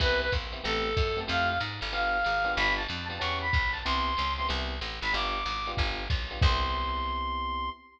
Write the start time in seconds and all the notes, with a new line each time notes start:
0.00 C2 B3 C4 E4 G4 B4, kick, crash, ride
0.21 B4
0.32 A#1, kick, hi-hat pedal, ride
0.52 B3 C4 E4 G4, ride
0.64 A1 A3 B3 C4 G4 A4, ride
0.97 F#2, kick, hi-hat pedal, ride
1.17 A3 B3 C4 G4, ride
1.27 F2 A3 E4 F4 G4 F5, ride
1.49 F5
1.60 G#2, hi-hat pedal, ride
1.81 G1, ride
1.92 B3 D4 F4 G4 F5, ride
2.24 G#1, hi-hat pedal, ride
2.44 B3 D4 F4 G4, ride
2.56 G1 B5, ride
2.77 A5
2.88 F2, hi-hat pedal, ride
3.08 B3 D4 F4 G4 A5, ride
3.20 E2 B3 C#4 E4 G4 C#6, ride
3.41 B5
3.53 B1, kick, hi-hat pedal, ride
3.72 A5, ride
3.85 C2 B3 C4 E4 G4 C6, ride
4.17 C#2, hi-hat pedal, ride
4.37 B3 C4 E4 G4 C6, ride
4.48 C2 B3 C4 E4 G4, ride
4.81 A1, hi-hat pedal, ride
5.01 G#1 B5, ride
5.13 G1 B3 D4 F4 G4 D6, ride
5.46 G#1, hi-hat pedal, ride
5.66 B3 D4 F4 G4, ride
5.77 G1, kick, ride
6.10 B1, kick, hi-hat pedal, ride
6.31 B3 D4 F4 G4, ride
6.41 C2 B3 C4 E4 G4 C6, kick, crash